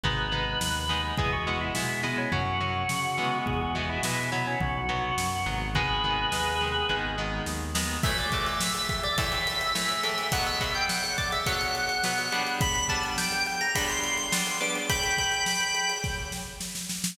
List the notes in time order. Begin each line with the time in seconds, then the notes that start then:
0.03 G#1 G#3 B3 D#4 B4, kick, floor tom
0.32 G#3 B3 D#4, floor tom
0.60 D#2, snare
0.89 G#3 B3 D#4, floor tom
1.17 E2 G#3 B3 E4 G#4, kick, floor tom
1.33 F#4
1.47 G#3 B3 E4, floor tom
1.61 E4
1.75 B2 G#3 B3 E4, snare
2.03 G#3 B3 E4, floor tom
2.18 C#4
2.32 F#2 F#3 C#4 F#4, kick, floor tom
2.60 F#3 C#4, floor tom
2.89 C#3, snare
3.18 E3 G#3 B3, floor tom
3.46 E2 G#4, kick, floor tom
3.61 F#4
3.75 E3 G#3 B3, floor tom
3.89 E4
4.03 B2 E3 G#3 B3 E4, snare
4.32 F#3 B3 E4, floor tom
4.47 C#4
4.60 B1 F#4, kick, floor tom
4.89 F#3 B3, floor tom
5.18 F#2, snare
5.46 G#1 F#3 B3, floor tom
5.75 D#3 G#3 B3 G#4 B4, kick, floor tom
6.03 D#3 G#3 B3, floor tom
6.32 D#2 D#3 G#3 B3, snare
6.61 D#3 G#3 B3, floor tom
6.89 G#1 D#3 G#3 B3, kick
7.18 D#3 G#3 B3
7.46 D#2, snare
7.75 D#3 G#3 B3, snare
8.03 A2 E3 A3 E5, kick, crash
8.18 D5, ride
8.32 A2 E3 A3, kick, ride
8.46 E5, ride
8.60 E5, snare
8.75 ride
8.89 E5, kick, ride
9.03 D5, ride
9.18 A2 E3 A3 E5, kick, ride
9.32 ride
9.47 ride
9.61 ride
9.75 A2 E3 A3, snare
9.89 ride
10.03 A2 E3 A3, ride
10.18 ride
10.32 B2 F#3 B3 F#5, kick, ride
10.46 E5, ride
10.60 B2 F#3 B3, kick, ride
10.75 G5, ride
10.89 F#5, snare
11.04 ride
11.18 D5, kick, ride
11.32 E5, ride
11.46 B2 F#3 B3 F#5, kick, ride
11.61 ride
11.75 ride
11.89 ride
12.04 B2 F#3 B3, snare
12.18 ride
12.32 G3 B3 D4, ride
12.47 ride
12.61 B5, kick, ride
12.75 ride
12.89 G3 B3 D4 A5, kick, ride
13.03 ride
13.18 G5, snare
13.32 ride
13.46 G5, ride
13.61 A#5, ride
13.75 G3 B3 D4 B5, kick, ride
13.89 C6, ride
14.03 ride
14.18 ride
14.32 G3 B3 D4 C6, snare
14.46 ride
14.60 G3 B3 D4 D6, ride
14.75 ride
14.90 G5 B5, kick, ride
15.03 ride
15.18 kick, ride
15.32 ride
15.46 snare
15.60 ride
15.75 ride
15.89 ride
16.04 kick, snare
16.32 snare
16.60 snare
16.75 snare
16.90 snare
17.04 snare